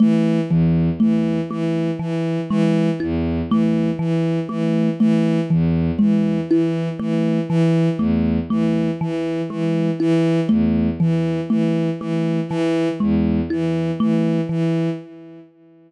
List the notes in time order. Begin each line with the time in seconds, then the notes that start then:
0.00 E3 A3
0.49 E2 E3
1.00 E3 A3
1.51 E3 A3
1.99 E3
2.50 E3 G#3
3.00 E2 E4
3.50 E3 A3
3.99 E3
4.49 E3 A3
5.00 E3 A3
5.50 E2 E3
5.99 E3 G#3
6.49 E3 E4
6.99 E3 A3
7.49 E3
7.98 E2 A3
8.50 E3 A3
9.01 E3
9.50 E3 G#3
10.00 E3 E4
10.49 E2 A3
11.00 E3
11.50 E3 A3
12.00 E3 A3
12.48 E3
13.00 E2 G#3
13.50 E3 E4
14.00 E3 A3
14.49 E3